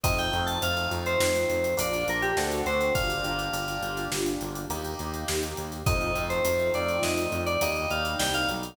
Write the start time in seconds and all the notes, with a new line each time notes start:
0.04 F2 A3 C4 D#4 F4 D#5, kick, closed hi-hat
0.18 G5, closed hi-hat
0.33 F2, closed hi-hat
0.46 A5, closed hi-hat
0.61 F2 A3 C4 D#4 F4 F5, closed hi-hat
0.77 closed hi-hat
0.91 F2, closed hi-hat
1.06 C5, closed hi-hat
1.20 F2, snare
1.35 closed hi-hat
1.50 F2, closed hi-hat
1.64 closed hi-hat
1.77 A#1 A#3 D4 F4 D5, closed hi-hat
1.93 closed hi-hat
2.08 A#1 A#4, closed hi-hat
2.22 G4, closed hi-hat
2.37 D2 A3 C4 D4 F#4 A4, snare
2.51 closed hi-hat
2.66 D2 C5, closed hi-hat
2.81 closed hi-hat
2.94 G1 A#3 D4 F4 G4 F5, kick, closed hi-hat
3.10 closed hi-hat
3.24 G1, closed hi-hat
3.39 closed hi-hat
3.52 G1 A#3 D4 F4 G4, closed hi-hat
3.68 closed hi-hat
3.82 G1, closed hi-hat
3.97 closed hi-hat
4.12 G1, snare
4.26 closed hi-hat
4.41 G1, closed hi-hat
4.55 closed hi-hat
4.69 D#2 A#3 D#4 G4, closed hi-hat
4.84 closed hi-hat
4.99 D#2, closed hi-hat
5.14 closed hi-hat
5.28 D#2, snare
5.43 closed hi-hat
5.57 D#2, closed hi-hat
5.72 closed hi-hat
5.86 F2 A3 C4 D#4 F4 D#5, kick, closed hi-hat
6.01 closed hi-hat
6.15 F2, closed hi-hat
6.29 C5, closed hi-hat
6.44 F2 A3 C4 D#4 F4, closed hi-hat
6.59 closed hi-hat
6.74 F2 D5, closed hi-hat
6.88 closed hi-hat
7.02 F2 D#5, snare
7.17 closed hi-hat
7.32 F2, closed hi-hat
7.46 D5, closed hi-hat
7.61 D#2 G3 A#3 D#4 D#5, closed hi-hat
7.76 closed hi-hat
7.90 D#2 F5, closed hi-hat
8.05 closed hi-hat
8.19 C2 G5, snare
8.34 F5, closed hi-hat
8.48 B1, closed hi-hat
8.63 closed hi-hat